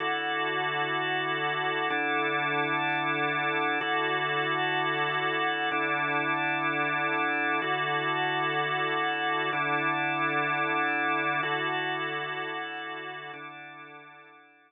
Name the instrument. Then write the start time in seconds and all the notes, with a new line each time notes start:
drawbar organ
0.00 D3 E4 F#4 A4
1.90 D3 D4 E4 A4
3.81 D3 E4 F#4 A4
5.72 D3 D4 E4 A4
7.62 D3 E4 F#4 A4
9.53 D3 D4 E4 A4
11.43 D3 E4 F#4 A4
13.34 D3 D4 E4 A4